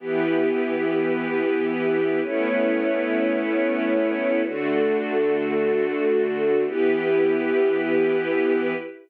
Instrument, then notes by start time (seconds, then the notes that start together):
string ensemble 1
0.00 E3 B3 E4 G4 B4
2.23 A3 B3 C#4 E4 B4 C#5
4.44 D3 A3 D4 F#4 A4
6.67 E3 B3 E4 G4 B4